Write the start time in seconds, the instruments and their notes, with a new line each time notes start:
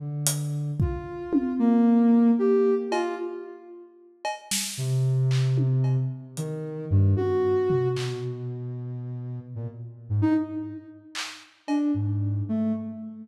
0.00 ocarina D3
0.27 closed hi-hat
0.80 ocarina F4, kick
1.33 high tom
1.59 ocarina A#3
2.39 ocarina G4
2.91 ocarina F4, cowbell
4.25 cowbell
4.51 snare
4.77 ocarina C3
5.31 clap
5.58 high tom
5.84 cowbell
6.37 ocarina D#3, closed hi-hat
6.90 ocarina G2
7.16 ocarina F#4, high tom
7.70 floor tom
7.96 ocarina B2, clap
9.55 ocarina A#2
10.09 ocarina G#2
10.22 ocarina D#4
11.15 clap
11.68 ocarina D4, cowbell
11.94 ocarina G#2
12.49 ocarina A3